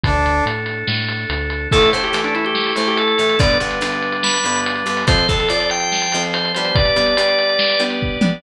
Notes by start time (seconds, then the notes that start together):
0.04 D2 D4 A4, kick, closed hi-hat
0.26 closed hi-hat
0.46 A2, closed hi-hat
0.66 closed hi-hat
0.87 A2, snare
1.08 closed hi-hat
1.30 D2, closed hi-hat
1.50 closed hi-hat
1.71 A2 E3 A3 E4 A4, kick, crash
1.82 closed hi-hat
1.93 A2 E3 A3 C5, closed hi-hat
2.03 G4, closed hi-hat
2.13 A2 E3 A3, closed hi-hat
2.24 D4, closed hi-hat
2.35 E4, closed hi-hat
2.45 G4, closed hi-hat
2.55 snare
2.67 closed hi-hat
2.76 A2 E3 A3 C5, closed hi-hat
2.87 G4, closed hi-hat
2.97 A4, closed hi-hat
3.08 closed hi-hat
3.18 A2 E3 A3, closed hi-hat
3.29 closed hi-hat
3.39 G2 D3 G3 B3 D4 B4 D5, kick, closed hi-hat
3.50 closed hi-hat
3.60 G2 D3 B3, closed hi-hat
3.71 closed hi-hat
3.81 G2 D3 B3, closed hi-hat
3.92 closed hi-hat
4.03 closed hi-hat
4.12 closed hi-hat
4.23 B5, snare
4.34 closed hi-hat
4.44 G2 D3 B3, closed hi-hat
4.56 closed hi-hat
4.66 closed hi-hat
4.76 closed hi-hat
4.86 G2 D3 B3, closed hi-hat
4.97 open hi-hat
5.07 F2 F3 C4 F4 C5, kick, closed hi-hat
5.18 closed hi-hat
5.28 F2 F3 C4 A4, kick, closed hi-hat
5.39 A4, closed hi-hat
5.49 F2 F3 C4 D5, closed hi-hat
5.60 D5, closed hi-hat
5.70 G5, closed hi-hat
5.80 closed hi-hat
5.92 snare
6.02 closed hi-hat
6.12 F2 F3 C4, closed hi-hat
6.23 closed hi-hat
6.34 C5, closed hi-hat
6.45 closed hi-hat
6.55 G3 B3 D4 C5, closed hi-hat
6.65 C5, closed hi-hat
6.75 G4 B4 D5, kick, closed hi-hat
6.85 closed hi-hat
6.96 G3 B3 D4, closed hi-hat
7.06 closed hi-hat
7.17 G3 B3 D4, closed hi-hat
7.29 closed hi-hat
7.39 closed hi-hat
7.49 closed hi-hat
7.59 snare
7.70 closed hi-hat
7.80 G3 B3 D4, closed hi-hat
7.90 closed hi-hat
8.02 kick
8.21 G3 B3 D4, mid tom